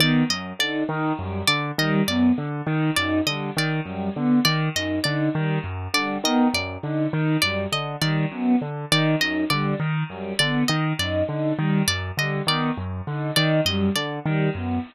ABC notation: X:1
M:5/4
L:1/8
Q:1/4=101
K:none
V:1 name="Acoustic Grand Piano" clef=bass
^D, ^F,, =D, ^D, F,, =D, ^D, F,, =D, ^D, | ^F,, D, ^D, F,, =D, ^D, F,, =D, ^D, F,, | D, ^D, ^F,, =D, ^D, F,, =D, ^D, F,, =D, | ^D, ^F,, =D, ^D, F,, =D, ^D, F,, =D, ^D, |
^F,, D, ^D, F,, =D, ^D, F,, =D, ^D, F,, |]
V:2 name="Choir Aahs"
B, z ^D D G, z G, B, z D | ^D G, z G, B, z D D G, z | G, B, z ^D D G, z G, B, z | ^D D G, z G, B, z D D G, |
z G, B, z ^D D G, z G, B, |]
V:3 name="Pizzicato Strings"
d ^d =d z2 d ^d =d z2 | d ^d =d z2 d ^d =d z2 | d ^d =d z2 d ^d =d z2 | d ^d =d z2 d ^d =d z2 |
d ^d =d z2 d ^d =d z2 |]